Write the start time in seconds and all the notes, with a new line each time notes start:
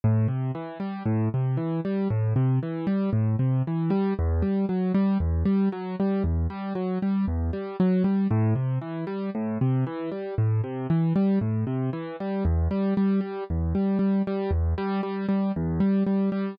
0.04 A2
0.28 C3
0.55 E3
0.80 G3
1.05 A2
1.34 C3
1.57 E3
1.85 G3
2.10 A2
2.36 C3
2.63 E3
2.87 G3
3.13 A2
3.39 C3
3.67 E3
3.90 G3
4.19 E2
4.42 G3
4.69 F#3
4.94 G3
5.20 E2
5.45 G3
5.72 F#3
6.00 G3
6.24 E2
6.50 G3
6.75 F#3
7.02 G3
7.27 E2
7.53 G3
7.80 F#3
8.04 G3
8.31 A2
8.55 C3
8.81 E3
9.07 G3
9.35 A2
9.61 C3
9.87 E3
10.12 G3
10.38 A2
10.64 C3
10.90 E3
11.16 G3
11.41 A2
11.67 C3
11.93 E3
12.20 G3
12.45 E2
12.71 G3
12.97 G3
13.21 G3
13.50 E2
13.75 G3
13.99 G3
14.27 G3
14.51 E2
14.78 G3
15.03 G3
15.29 G3
15.56 E2
15.80 G3
16.06 G3
16.32 G3